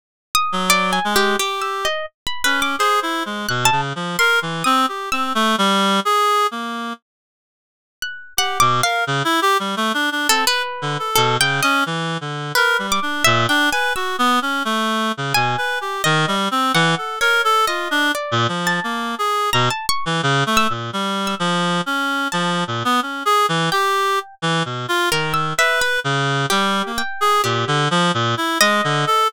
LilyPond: <<
  \new Staff \with { instrumentName = "Clarinet" } { \time 2/4 \tempo 4 = 86 r8. ges8. aes8 | g'8. r8. des'8 | \tuplet 3/2 { aes'8 e'8 aes8 b,8 des8 f8 } | \tuplet 3/2 { bes'8 e8 c'8 g'8 c'8 a8 } |
\tuplet 3/2 { g4 aes'4 bes4 } | r2 | \tuplet 3/2 { g'8 b,8 bes'8 } des16 e'16 g'16 g16 | a16 d'16 d'16 c'16 b'16 r16 d16 a'16 |
\tuplet 3/2 { b,8 des8 des'8 } e8 d8 | \tuplet 3/2 { bes'8 g8 d'8 bes,8 d'8 b'8 } | \tuplet 3/2 { ges'8 b8 des'8 } a8. des16 | \tuplet 3/2 { b,8 b'8 g'8 ees8 g8 c'8 } |
\tuplet 3/2 { e8 a'8 bes'8 a'8 f'8 d'8 } | r16 bes,16 f8 bes8 aes'8 | b,16 r8 e16 \tuplet 3/2 { des8 a8 bes,8 } | \tuplet 3/2 { g4 f4 des'4 } |
f8 bes,16 b16 \tuplet 3/2 { des'8 aes'8 e8 } | g'8. r16 \tuplet 3/2 { e8 b,8 f'8 } | \tuplet 3/2 { ees4 b'4 des4 } | g8 bes16 r16 \tuplet 3/2 { aes'8 bes,8 d8 } |
\tuplet 3/2 { f8 bes,8 e'8 aes8 d8 a'8 } | }
  \new Staff \with { instrumentName = "Orchestral Harp" } { \time 2/4 r8 ees'''8 \tuplet 3/2 { d''8 aes''8 g'8 } | \tuplet 3/2 { g'8 e'''8 ees''8 } r16 b''16 b'16 d'''16 | c''4 ges'''16 a''16 r8 | \tuplet 3/2 { c'''4 ees'''4 e'''4 } |
r2 | r4. ges'''8 | \tuplet 3/2 { ges''8 d'''8 f''8 } r4 | r8. a'16 b'4 |
\tuplet 3/2 { a'8 g''8 ees''8 } r4 | b'8 d'''8 \tuplet 3/2 { e''8 g''8 aes''8 } | e'''4. r8 | aes''4 ees''8 r8 |
\tuplet 3/2 { ges''4 des''4 ees''4 } | d''8 r16 a''4~ a''16 | bes''16 a''16 des'''16 r8. e'''16 r16 | r8 e'''4. |
a''2 | g''4 r4 | \tuplet 3/2 { bes'8 e'''8 e''8 } b''16 r8. | \tuplet 3/2 { g'4 g''4 g'4 } |
r4 ees''4 | }
>>